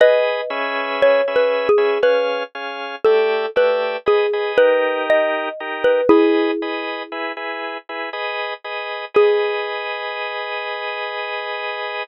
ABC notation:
X:1
M:3/4
L:1/16
Q:1/4=59
K:G#m
V:1 name="Xylophone"
[Bd]4 (3c2 B2 G2 B2 z2 | =A2 B2 G2 B2 d3 B | [EG]6 z6 | G12 |]
V:2 name="Drawbar Organ"
[GBd]2 [CGBe]3 [CGBe]2 [CGBe] [CG^e]2 [CGe]2 | [=A,=G=de]2 [A,Gde]2 [^GB^d] [GBd] [D=G^A]4 [DGA]2 | [GBd]2 [GBd]2 [EGB] [EGB]2 [EGB] [GBd]2 [GBd]2 | [GBd]12 |]